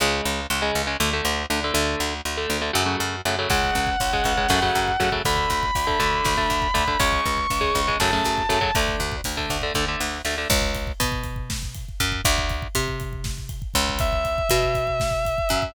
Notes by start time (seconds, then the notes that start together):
0.00 C#2 C#3 G#3
0.25 C#2
0.50 C#2
0.62 C#3 G#3
0.75 C#2
0.87 C#3 G#3
1.00 D2 D3 A3
1.13 D3 A3
1.25 D2
1.50 D2 D3 A3
1.64 D3 A3
1.74 D2 D3 A3
2.00 D2
2.25 D2
2.37 D3 A3
2.50 D2
2.61 D3 A3
2.73 F#2 C#3 F#3 A3
2.86 C#3 F#3 A3
3.00 F#2
3.25 F#2 C#3 F#3 A3
3.39 C#3 F#3 A3
3.50 C#2 C#3 G#3 F#5, kick, crash
3.64 kick
3.75 C#2, kick, closed hi-hat
3.87 kick
4.00 C#2, kick, closed hi-hat
4.13 C#3 G#3, kick
4.24 C#2, kick, closed hi-hat
4.37 C#3 G#3, kick
4.49 F#2 C#3 F#3 A3, kick, snare
4.62 C#3 F#3 A3, kick
4.75 F#2, kick, closed hi-hat
4.88 kick
5.00 F#2 C#3 F#3 A3, kick, closed hi-hat
5.12 C#3 F#3 A3, kick
5.25 D2 D3 A3 B5, kick, closed hi-hat
5.36 kick
5.50 D2, kick, closed hi-hat
5.63 kick
5.75 D2, kick, closed hi-hat
5.87 D3 A3, kick
5.99 D2 D3 A3, kick, closed hi-hat
6.13 kick
6.25 D2, kick, snare
6.37 D3 A3, kick
6.50 D2, kick, closed hi-hat
6.62 kick
6.74 D2 D3 A3, kick, closed hi-hat
6.88 D3 A3, kick
6.99 C#2 C#3 G#3 C#6, kick, closed hi-hat
7.13 kick
7.26 C#2, kick, closed hi-hat
7.37 kick
7.50 C#2, kick, closed hi-hat
7.61 C#3 G#3, kick
7.75 C#2, kick, closed hi-hat
7.88 C#3 G#3, kick
8.00 F#2 C#3 F#3 A3 A5, kick, snare, closed hi-hat
8.12 C#3 F#3 A3, kick
8.24 F#2, kick, closed hi-hat
8.38 kick
8.49 F#2 C#3 F#3 A3, kick, closed hi-hat
8.61 C#3 F#3 A3, kick
8.75 D2 D3 A3, kick, closed hi-hat
8.88 kick
9.00 D2, kick, closed hi-hat
9.12 kick
9.24 D2, kick, closed hi-hat
9.37 D3 A3, kick
9.49 D2, kick, closed hi-hat
9.61 D3 A3, kick
9.74 D2 D3 A3, kick
9.88 D3 A3
10.00 D2, snare
10.25 D2 D3 A3, snare
10.38 D3 A3
10.50 C#2, kick, crash
10.62 kick
10.75 kick, ride
10.87 kick
11.00 B2, kick, ride
11.12 kick
11.24 kick, ride
11.36 kick
11.50 kick, snare
11.63 kick
11.74 kick, ride
11.89 kick
12.00 F#2, kick, ride
12.12 kick
12.25 D2, kick, ride
12.38 kick
12.49 kick, ride
12.62 kick
12.75 C3, kick, ride
12.88 kick
13.00 kick, ride
13.13 kick
13.24 kick, snare
13.38 kick
13.49 kick, ride
13.62 kick
13.74 C#2, kick, ride
13.89 kick
13.99 E5, kick, ride
14.12 kick
14.25 kick, ride
14.38 kick
14.49 B2, kick, ride
14.62 kick
14.75 kick, ride
14.87 kick
15.00 kick, snare
15.11 kick
15.25 kick, ride
15.38 kick
15.49 F#2, kick, ride
15.62 kick